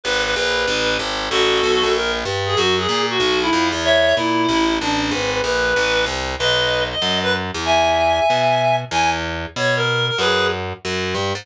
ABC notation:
X:1
M:4/4
L:1/8
Q:"Swing" 1/4=189
K:A
V:1 name="Clarinet"
B B B4 z2 | [FA]4 _B z2 _A | F G2 F2 E2 z | [ce]2 E4 D2 |
B B B4 z2 | [K:B] [Bd]3 d2 B z2 | [eg]8 | g z3 c A2 A |
[GB]2 z6 |]
V:2 name="Electric Bass (finger)" clef=bass
G,,,2 _B,,,2 A,,,2 G,,,2 | A,,,2 B,,, _B,,,3 =G,,2 | F,,2 _B,,2 =B,,,2 =F,, E,,- | E,,2 _B,,2 A,,,2 A,,,2 |
G,,,2 _B,,,2 A,,,2 =C,,2 | [K:B] B,,,4 F,,3 E,,- | E,,4 B,,4 | E,,4 B,,4 |
F,,4 F,,2 =G,, ^G,, |]